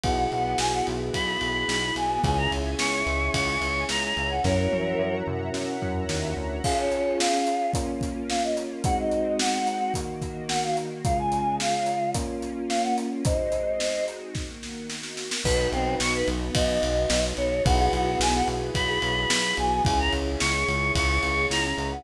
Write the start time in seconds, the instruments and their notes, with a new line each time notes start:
0.04 synth bass 1 B1, string ensemble 1 B3 E4 F#4 G#4, electric piano 1 B3 E4 F#4 G#4, choir aahs F#5, kick, ride
0.31 synth bass 1 B1, choir aahs F#5, ride
0.58 synth bass 1 B1, choir aahs G#5, snare
0.73 choir aahs F#5
0.87 synth bass 1 B1, ride
1.13 synth bass 1 B1, choir aahs B5, kick, ride
1.41 synth bass 1 B1, ride
1.68 synth bass 1 B1, snare
1.96 synth bass 1 B1, choir aahs G#5, ride
2.24 synth bass 1 C#2, electric piano 1 C#4 E4 G#4, string ensemble 1 C#5 E5 G#5, choir aahs G#5, kick, ride
2.38 choir aahs A#5
2.52 synth bass 1 C#2, ride
2.79 synth bass 1 C#2, choir aahs C#6, snare
3.06 synth bass 1 C#2, ride
3.34 synth bass 1 C#2, choir aahs C#6, kick, ride
3.61 synth bass 1 C#2, ride
3.89 synth bass 1 C#2, choir aahs A#5, snare
4.03 choir aahs A#5
4.17 synth bass 1 C#2, ride
4.30 choir aahs F#5
4.44 synth bass 1 F#2, electric piano 1 C#4 E4 F#4 A#4, choir aahs A#4 C#5, string ensemble 1 C#5 E5 F#5 A#5, kick, snare
4.72 synth bass 1 F#2, high tom
4.99 synth bass 1 F#2
5.27 synth bass 1 F#2, mid tom
5.54 synth bass 1 F#2, snare
5.82 synth bass 1 F#2, floor tom
6.09 synth bass 1 D#2, snare
6.37 synth bass 1 D2
6.64 electric piano 1 C#4 F4 G#4, string ensemble 1 C#4 F4 G#4, choir aahs F5, kick, crash
6.78 choir aahs C#5
6.92 closed hi-hat
7.19 choir aahs F5, snare
7.47 closed hi-hat
7.74 electric piano 1 A#3 C#4 F4, string ensemble 1 A#3 C#4 F4, kick, closed hi-hat
8.01 kick, closed hi-hat
8.30 choir aahs F5, snare
8.43 choir aahs D#5
8.57 closed hi-hat
8.84 string ensemble 1 G#3 C4 D#4 F#4, electric piano 1 G#3 C4 D#4 F#4, choir aahs F#5, kick, closed hi-hat
8.99 choir aahs D#5
9.12 closed hi-hat
9.39 choir aahs F#5, snare
9.67 closed hi-hat
9.94 string ensemble 1 D#3 A#3 F#4, electric piano 1 D#3 A#3 F#4, kick, closed hi-hat
10.22 kick, closed hi-hat
10.49 choir aahs F#5, snare
10.63 choir aahs F5
10.77 closed hi-hat
11.05 electric piano 1 C#3 G#3 F4, string ensemble 1 C#3 G#3 F4, choir aahs F5, kick, closed hi-hat
11.19 choir aahs G#5
11.32 closed hi-hat
11.60 choir aahs F5, snare
11.86 closed hi-hat
12.14 string ensemble 1 A#3 C#4 F4, electric piano 1 A#3 C#4 F4, kick, closed hi-hat
12.42 closed hi-hat
12.69 choir aahs F5, snare
12.83 choir aahs F#5
12.98 closed hi-hat
13.25 string ensemble 1 G#3 C4 D#4 F#4, choir aahs C5 D#5, kick, closed hi-hat
13.52 closed hi-hat
13.80 snare
14.08 closed hi-hat
14.34 string ensemble 1 D#3 A#3 F#4, kick, snare
14.63 snare
14.90 snare
15.03 snare
15.17 snare
15.31 snare
15.44 synth bass 1 B1, string ensemble 1 B3 D#4 F#4, electric piano 1 D#4 F#4 B4, choir aahs B4, kick, crash
15.72 synth bass 1 B1, choir aahs C4, ride
16.00 synth bass 1 B1, choir aahs C#6, snare
16.14 choir aahs B4
16.27 synth bass 1 B1, ride
16.55 synth bass 1 B1, choir aahs D#5, kick, ride
16.83 synth bass 1 B1, ride
17.10 synth bass 1 B1, snare
17.37 synth bass 1 B1, choir aahs C#5, ride
17.65 synth bass 1 B1, string ensemble 1 B3 E4 F#4 G#4, electric piano 1 E4 F#4 G#4 B4, choir aahs F#5, kick, ride
17.92 synth bass 1 B1, choir aahs F#4, ride
18.19 synth bass 1 B1, choir aahs G#5, snare
18.34 choir aahs F#5
18.48 synth bass 1 B1, ride
18.75 synth bass 1 B1, choir aahs B5, kick, ride
19.02 synth bass 1 B1, ride
19.30 synth bass 1 B1, snare
19.57 synth bass 1 B1, choir aahs G#5, ride
19.85 synth bass 1 C#2, string ensemble 1 C#4 E4 G#4, electric piano 1 E4 G#4 C#5, choir aahs G#5, kick, ride
19.99 choir aahs A#5
20.13 synth bass 1 C#2, ride
20.40 synth bass 1 C#2, choir aahs C#6, snare
20.68 synth bass 1 C#2, ride
20.95 synth bass 1 C#2, choir aahs C#6, kick, ride
21.23 synth bass 1 C#2, ride
21.50 synth bass 1 C#2, choir aahs A#5, snare
21.64 choir aahs A#5
21.77 synth bass 1 C#2, ride
21.92 choir aahs F#5